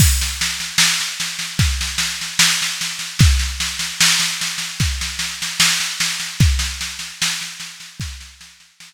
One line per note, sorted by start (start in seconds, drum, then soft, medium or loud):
0.00 kick loud
0.00 snare medium
0.00 crash loud
0.21 snare medium
0.41 snare medium
0.60 snare medium
0.78 snare loud
1.00 snare medium
1.20 snare medium
1.39 snare medium
1.59 kick medium
1.59 snare medium
1.81 snare medium
1.98 snare medium
2.21 snare medium
2.39 snare loud
2.62 snare medium
2.81 snare medium
2.99 snare medium
3.19 kick loud
3.19 snare medium
3.39 snare medium
3.60 snare medium
3.79 snare medium
4.00 snare loud
4.20 snare medium
4.41 snare medium
4.58 snare medium
4.80 kick medium
4.80 snare medium
5.01 snare medium
5.19 snare medium
5.42 snare medium
5.60 snare loud
5.80 snare medium
6.00 snare medium
6.20 snare medium
6.40 kick loud
6.40 snare medium
6.59 snare medium
6.81 snare medium
6.99 snare medium
7.22 snare loud
7.41 snare medium
7.60 snare medium
7.80 snare medium
8.00 kick loud
8.00 snare medium
8.21 snare medium
8.41 snare medium
8.60 snare medium
8.80 snare loud